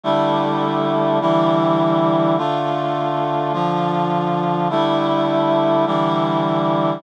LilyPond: \new Staff { \time 4/4 \key d \dorian \tempo 4 = 103 <d g a e'>2 <d e g e'>2 | <d a f'>2 <d f f'>2 | <d g a e'>2 <d e g e'>2 | }